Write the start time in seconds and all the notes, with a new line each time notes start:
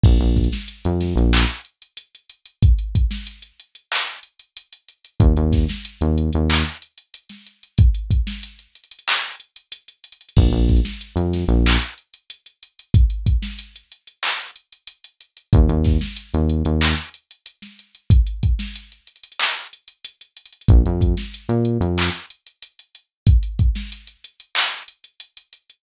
0.03 A#1, kick, crash
0.19 A#1, closed hi-hat
0.37 kick, closed hi-hat
0.44 closed hi-hat
0.52 snare, closed hi-hat
0.61 closed hi-hat
0.68 closed hi-hat
0.85 F2, closed hi-hat
1.01 snare, closed hi-hat
1.16 A#1, closed hi-hat
1.33 clap
1.49 closed hi-hat
1.65 closed hi-hat
1.82 closed hi-hat
1.97 closed hi-hat
2.15 closed hi-hat
2.30 closed hi-hat
2.46 closed hi-hat
2.63 kick, closed hi-hat
2.79 closed hi-hat
2.95 kick, closed hi-hat
3.11 snare, closed hi-hat
3.27 closed hi-hat
3.42 closed hi-hat
3.60 closed hi-hat
3.75 closed hi-hat
3.92 clap
4.08 closed hi-hat
4.23 closed hi-hat
4.40 closed hi-hat
4.57 closed hi-hat
4.73 closed hi-hat
4.89 closed hi-hat
5.05 closed hi-hat
5.20 D#2, kick, closed hi-hat
5.37 D#2, closed hi-hat
5.52 kick, snare, closed hi-hat
5.69 snare, closed hi-hat
5.85 closed hi-hat
6.01 D#2, closed hi-hat
6.18 closed hi-hat
6.33 D#2, closed hi-hat
6.50 clap
6.66 closed hi-hat
6.82 closed hi-hat
6.98 closed hi-hat
7.14 closed hi-hat
7.30 snare, closed hi-hat
7.47 closed hi-hat
7.63 closed hi-hat
7.78 kick, closed hi-hat
7.95 closed hi-hat
8.11 kick, closed hi-hat
8.27 snare, closed hi-hat
8.43 closed hi-hat
8.59 closed hi-hat
8.75 closed hi-hat
8.84 closed hi-hat
8.92 closed hi-hat
8.99 closed hi-hat
9.08 clap
9.24 closed hi-hat
9.40 closed hi-hat
9.56 closed hi-hat
9.72 closed hi-hat
9.88 closed hi-hat
10.04 closed hi-hat
10.12 closed hi-hat
10.21 closed hi-hat
10.29 closed hi-hat
10.37 A#1, kick, crash
10.51 A#1, closed hi-hat
10.69 kick, closed hi-hat
10.76 closed hi-hat
10.85 snare, closed hi-hat
10.93 closed hi-hat
11.01 closed hi-hat
11.16 F2, closed hi-hat
11.33 snare, closed hi-hat
11.48 A#1, closed hi-hat
11.66 clap
11.82 closed hi-hat
11.98 closed hi-hat
12.14 closed hi-hat
12.30 closed hi-hat
12.46 closed hi-hat
12.63 closed hi-hat
12.79 closed hi-hat
12.94 kick, closed hi-hat
13.10 closed hi-hat
13.26 kick, closed hi-hat
13.42 snare, closed hi-hat
13.59 closed hi-hat
13.76 closed hi-hat
13.92 closed hi-hat
14.07 closed hi-hat
14.23 clap
14.40 closed hi-hat
14.56 closed hi-hat
14.73 closed hi-hat
14.87 closed hi-hat
15.04 closed hi-hat
15.21 closed hi-hat
15.37 closed hi-hat
15.53 D#2, kick, closed hi-hat
15.69 D#2, closed hi-hat
15.84 kick, snare, closed hi-hat
16.01 snare, closed hi-hat
16.17 closed hi-hat
16.34 D#2, closed hi-hat
16.50 closed hi-hat
16.65 D#2, closed hi-hat
16.81 clap
16.98 closed hi-hat
17.14 closed hi-hat
17.31 closed hi-hat
17.46 closed hi-hat
17.62 snare, closed hi-hat
17.79 closed hi-hat
17.95 closed hi-hat
18.10 kick, closed hi-hat
18.27 closed hi-hat
18.43 kick, closed hi-hat
18.59 snare, closed hi-hat
18.76 closed hi-hat
18.92 closed hi-hat
19.07 closed hi-hat
19.16 closed hi-hat
19.24 closed hi-hat
19.32 closed hi-hat
19.40 clap
19.56 closed hi-hat
19.73 closed hi-hat
19.88 closed hi-hat
20.05 closed hi-hat
20.21 closed hi-hat
20.37 closed hi-hat
20.46 closed hi-hat
20.53 closed hi-hat
20.61 closed hi-hat
20.69 A#1, kick, closed hi-hat
20.86 F2, closed hi-hat
21.01 kick, closed hi-hat
21.17 snare, closed hi-hat
21.34 closed hi-hat
21.49 A#2, closed hi-hat
21.65 closed hi-hat
21.81 F2, closed hi-hat
21.98 clap
22.14 closed hi-hat
22.30 closed hi-hat
22.47 closed hi-hat
22.62 closed hi-hat
22.79 closed hi-hat
22.95 closed hi-hat
23.27 kick, closed hi-hat
23.43 closed hi-hat
23.59 kick, closed hi-hat
23.75 snare, closed hi-hat
23.92 closed hi-hat
24.07 closed hi-hat
24.24 closed hi-hat
24.40 closed hi-hat
24.55 clap
24.73 closed hi-hat
24.88 closed hi-hat
25.04 closed hi-hat
25.20 closed hi-hat
25.37 closed hi-hat
25.53 closed hi-hat
25.70 closed hi-hat